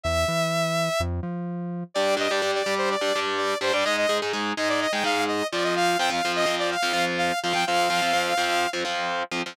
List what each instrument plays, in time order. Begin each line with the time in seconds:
0.03 synth bass 1 E2, lead 2 (sawtooth) E5
0.28 synth bass 1 E3
1.00 synth bass 1 F2
1.23 synth bass 1 F3
1.94 overdriven guitar G3 D4 G4, lead 2 (sawtooth) D5
2.17 overdriven guitar G3 D4 G4, lead 2 (sawtooth) D#5
2.30 overdriven guitar G3 D4 G4, lead 2 (sawtooth) D5
2.42 overdriven guitar G3 D4 G4
2.55 lead 2 (sawtooth) D5
2.66 overdriven guitar G3 D4 G4
2.78 lead 2 (sawtooth) C5
2.90 lead 2 (sawtooth) D5
3.01 overdriven guitar G3 D4 G4
3.16 overdriven guitar G3 D4 G4
3.37 lead 2 (sawtooth) D5
3.61 overdriven guitar G3 D4 G4, lead 2 (sawtooth) C5
3.73 overdriven guitar G3 D4 G4, lead 2 (sawtooth) D5
3.85 overdriven guitar G#3 D#4 G#4, lead 2 (sawtooth) D#5
3.97 lead 2 (sawtooth) D#5
4.09 overdriven guitar G#3 D#4 G#4
4.22 overdriven guitar G#3 D#4 G#4
4.33 overdriven guitar G#3 D#4 G#4
4.57 overdriven guitar G#3 D#4 G#4, lead 2 (sawtooth) D#5
4.69 lead 2 (sawtooth) D5
4.81 lead 2 (sawtooth) D#5
4.92 overdriven guitar G#3 D#4 G#4, lead 2 (sawtooth) G5
5.04 overdriven guitar G#3 D#4 G#4, lead 2 (sawtooth) F5
5.28 lead 2 (sawtooth) D#5
5.52 overdriven guitar F3 C4 F4, lead 2 (sawtooth) D5
5.64 lead 2 (sawtooth) D#5
5.76 lead 2 (sawtooth) F5
5.99 overdriven guitar F3 C4 F4, lead 2 (sawtooth) G5
6.10 overdriven guitar F3 C4 F4, lead 2 (sawtooth) F5
6.25 overdriven guitar F3 C4 F4
6.35 lead 2 (sawtooth) D#5
6.46 overdriven guitar F3 C4 F4
6.59 lead 2 (sawtooth) D5
6.71 lead 2 (sawtooth) F5
6.83 overdriven guitar F3 C4 F4
6.93 overdriven guitar F3 C4 F4
7.18 lead 2 (sawtooth) F5
7.43 overdriven guitar F3 C4 F4, lead 2 (sawtooth) F5
7.53 overdriven guitar F3 C4 F4, lead 2 (sawtooth) G5
7.67 overdriven guitar F3 C4 F4, lead 2 (sawtooth) F5
7.90 overdriven guitar F3 C4 F4
8.02 overdriven guitar F3 C4 F4
8.13 overdriven guitar F3 C4 F4
8.37 overdriven guitar F3 C4 F4
8.73 overdriven guitar F3 C4 F4
8.85 overdriven guitar F3 C4 F4
9.31 overdriven guitar F3 C4 F4
9.46 overdriven guitar F3 C4 F4